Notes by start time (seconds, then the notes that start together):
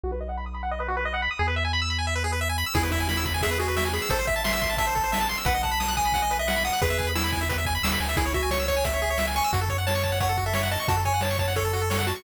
0.04 B1 F#4
0.12 B4
0.21 D#5
0.29 F#5
0.37 B5
0.46 D#6
0.54 B5
0.63 F#5
0.71 D#5
0.80 B4
0.88 F#4
0.97 B4
1.05 D#5
1.14 F#5
1.22 B5
1.31 D#6
1.39 E2 G#4
1.48 B4
1.56 E5
1.65 G#5
1.73 B5
1.82 E6
1.90 B5
1.99 G#5
2.07 E5
2.15 B4
2.24 G#4
2.32 B4
2.41 E5
2.49 G#5
2.58 B5
2.66 E6
2.74 E2 E4 G#4, kick, crash
2.83 B4
2.92 E4 E5, kick, closed hi-hat
3.00 G#5
3.09 E4 B5, snare
3.17 E6
3.25 B5, kick, closed hi-hat
3.34 G#5
3.41 G#4 E5, kick, closed hi-hat
3.51 B4
3.59 F#4 G#4, closed hi-hat
3.68 B4
3.76 E5, snare
3.85 G#5
3.93 G#4 B5, closed hi-hat
4.02 E6
4.09 A1 A4 C5, kick, closed hi-hat
4.19 C5
4.27 E5, kick, closed hi-hat
4.36 A5
4.44 E5 C6, snare
4.53 E6
4.61 C6, kick, closed hi-hat
4.70 A5
4.77 E5 A5, kick, closed hi-hat
4.87 C5
4.95 A4, kick, closed hi-hat
5.04 C5
5.12 E5, snare
5.21 A5
5.29 C6, closed hi-hat
5.37 E6
5.45 B1 B4 F#5, kick, closed hi-hat
5.54 D#5
5.63 F#5 A5, kick, closed hi-hat
5.71 B5
5.80 D#6, snare
5.88 F#6
5.97 G#5 D#6, kick, closed hi-hat
6.05 B5
6.12 F#5, kick, closed hi-hat
6.22 D#5
6.31 B4, closed hi-hat
6.39 D#5 E5
6.48 F#5, snare
6.56 B5
6.65 F#5 D#6, closed hi-hat
6.73 F#6
6.82 E2 G#4 B4, kick, closed hi-hat
6.90 E5
6.99 G#5, kick, closed hi-hat
7.07 B5
7.15 E4 E6, snare
7.24 B5
7.32 G#5, kick, closed hi-hat
7.41 E5
7.49 B4, kick, closed hi-hat
7.58 E5
7.65 G#5, kick, closed hi-hat
7.75 B5
7.83 D#2 E6, snare
7.92 B5
8.00 D2 G#5, closed hi-hat
8.09 E5
8.17 C#2 E4 G#4, kick, closed hi-hat
8.26 C#5
8.33 F#4 E5, kick, closed hi-hat
8.43 G#5
8.51 C#5 C#6, snare
8.60 E6
8.68 C#5 C#6, kick, closed hi-hat
8.76 G#5
8.84 E5, kick, closed hi-hat
8.93 C#5
9.01 G#4, closed hi-hat
9.10 C#5
9.18 E5, snare
9.27 G#5
9.35 G#5 C#6, closed hi-hat
9.44 E6
9.53 F#2 F#4, kick, closed hi-hat
9.61 A4
9.68 C#5, kick, closed hi-hat
9.78 F#5
9.87 C#5 A5, snare
9.95 C#6
10.03 A5, kick, closed hi-hat
10.12 F#5
10.20 C#5 F#5, kick, closed hi-hat
10.29 A4
10.37 F#4, kick, closed hi-hat
10.46 A4 E5
10.53 C#5, snare
10.63 F#5
10.71 D#5 A5, closed hi-hat
10.80 C#6
10.88 F#2 F#4 A5, kick, closed hi-hat
10.97 A4
11.05 C#5 G#5, kick, closed hi-hat
11.14 F#5
11.21 C#5 A5, snare
11.31 C#6
11.38 C#5 A5, kick, closed hi-hat
11.48 F#5
11.56 A4 C#5, kick, closed hi-hat
11.65 A4
11.73 F#4, closed hi-hat
11.82 A4
11.90 C#5, snare
11.99 F#5
12.06 F#4 A5, closed hi-hat
12.16 C#6